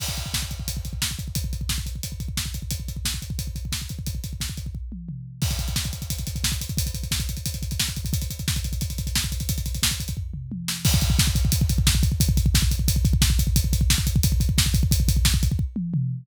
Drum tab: CC |x---------------|----------------|----------------|----------------|
HH |--x---x-x-x---x-|x-x---x-x-x---x-|x-x---x-x-x---x-|x-x---x---------|
SD |----o-------o---|----o-------o---|----o-------o---|----o-----------|
T1 |----------------|----------------|----------------|----------o-----|
T2 |----------------|----------------|----------------|------------o---|
FT |----------------|----------------|----------------|----------------|
BD |oooooooooooooooo|oooooooooooooooo|oooooooooooooooo|ooooooooo-------|

CC |x---------------|----------------|----------------|----------------|
HH |-xxx-xxxxxxx-xxx|xxxx-xxxxxxx-xxx|xxxx-xxxxxxx-xxx|xxxx-xxx--------|
SD |----o-------o---|----o-------o---|----o-------o---|----o---------o-|
T1 |----------------|----------------|----------------|------------o---|
T2 |----------------|----------------|----------------|----------o-----|
FT |----------------|----------------|----------------|--------o-------|
BD |oooooooooooooooo|oooooooooooooooo|oooooooooooooooo|ooooooooo-------|

CC |x---------------|----------------|----------------|----------------|
HH |--x---x-x-x---x-|x-x---x-x-x---x-|x-x---x-x-x---x-|x-x---x---------|
SD |----o-------o---|----o-------o---|----o-------o---|----o-----------|
T1 |----------------|----------------|----------------|----------o-----|
T2 |----------------|----------------|----------------|------------o---|
FT |----------------|----------------|----------------|----------------|
BD |oooooooooooooooo|oooooooooooooooo|oooooooooooooooo|ooooooooo-------|